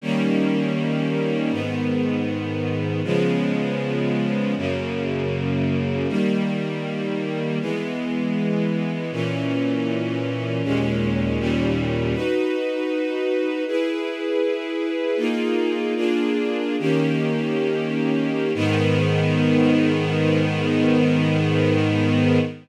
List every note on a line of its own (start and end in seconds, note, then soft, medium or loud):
0.01 1.51 D#3 medium
0.01 1.52 G3 medium
0.01 1.52 A#3 medium
0.01 1.52 C#4 medium
1.51 3.02 G#2 medium
1.51 3.02 D#3 medium
1.51 3.02 B3 medium
3.04 4.54 C#3 medium
3.04 4.54 F3 medium
3.04 4.54 G#3 medium
3.04 4.54 B3 medium
4.57 6.07 F#2 medium
4.57 6.07 C#3 medium
4.57 6.07 A#3 medium
6.08 7.59 D#3 medium
6.08 7.59 G3 medium
6.08 7.59 A#3 medium
7.60 9.11 E3 medium
7.60 9.11 G#3 medium
7.60 9.11 B3 medium
9.12 10.62 A#2 medium
9.12 10.62 E3 medium
9.12 10.62 C#4 medium
10.63 11.38 D#2 medium
10.63 11.38 A#2 medium
10.63 11.39 G#3 medium
10.63 11.38 C#4 medium
11.39 12.14 D#2 medium
11.39 12.14 A#2 medium
11.39 12.14 G3 medium
11.39 12.14 C#4 medium
12.14 13.64 D#4 medium
12.14 13.64 F#4 medium
12.14 13.64 B4 medium
13.67 15.18 E4 medium
13.67 15.17 G#4 medium
13.67 15.18 B4 medium
15.17 15.94 A#3 medium
15.17 15.94 D#4 medium
15.17 15.94 F4 medium
15.17 15.94 G#4 medium
15.96 16.76 A#3 medium
15.96 16.76 D4 medium
15.96 16.76 F4 medium
15.96 16.76 G#4 medium
16.79 18.52 D#3 medium
16.79 18.52 A#3 medium
16.79 18.52 C#4 medium
16.79 18.52 G4 medium
18.55 22.39 G#2 medium
18.55 22.39 D#3 loud
18.55 22.39 B3 loud